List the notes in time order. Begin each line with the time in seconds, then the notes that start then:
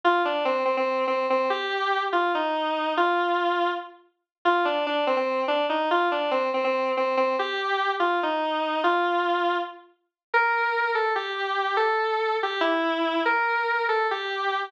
0.04 F4
0.25 D4
0.45 C4
0.65 C4
0.77 C4
1.07 C4
1.30 C4
1.50 G4
2.13 F4
2.35 D#4
2.97 F4
4.45 F4
4.65 D4
4.87 D4
5.07 C4
5.17 C4
5.48 D4
5.69 D#4
5.91 F4
6.12 D4
6.31 C4
6.54 C4
6.64 C4
6.97 C4
7.17 C4
7.39 G4
8.00 F4
8.23 D#4
8.84 F4
10.34 A#4
10.95 A4
11.15 G4
11.77 A4
12.43 G4
12.61 E4
13.25 A#4
13.89 A4
14.11 G4